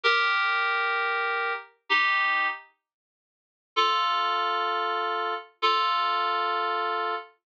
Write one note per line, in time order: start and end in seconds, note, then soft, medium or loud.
0.03 1.53 G4 loud
0.03 1.53 A#4 loud
1.89 2.47 D#4 medium
1.89 2.47 G4 loud
3.76 5.34 F4 medium
3.76 5.34 A4 loud
5.62 7.15 F4 loud
5.62 7.15 A4 loud